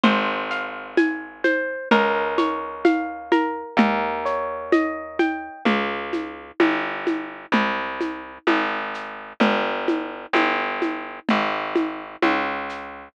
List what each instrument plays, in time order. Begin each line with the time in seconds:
0.04 electric bass (finger) G#1, orchestral harp C5, low conga, shaker
0.51 orchestral harp F5, shaker
0.97 orchestral harp G#5, high conga, shaker
1.44 orchestral harp C5, high conga, shaker
1.91 electric bass (finger) C#2, orchestral harp A#4, low conga, shaker
2.38 orchestral harp C#5, high conga, shaker
2.85 orchestral harp F5, high conga, shaker
3.32 orchestral harp A#4, high conga, shaker
3.77 electric bass (finger) D#2, orchestral harp A#4, low conga, shaker
4.25 orchestral harp C#5, shaker
4.72 orchestral harp D#5, high conga, shaker
5.19 orchestral harp G5, high conga, shaker
5.65 electric bass (finger) C#2, low conga, shaker
6.13 high conga, shaker
6.60 electric bass (finger) G1, high conga, shaker
7.07 high conga, shaker
7.52 electric bass (finger) C2, low conga, shaker
8.01 high conga, shaker
8.47 electric bass (finger) G#1, high conga, shaker
8.94 shaker
9.40 electric bass (finger) G1, low conga, shaker
9.88 high conga, shaker
10.33 electric bass (finger) G1, high conga, shaker
10.82 high conga, shaker
11.29 electric bass (finger) G#1, low conga, shaker
11.76 high conga, shaker
12.22 electric bass (finger) C#2, high conga, shaker
12.69 shaker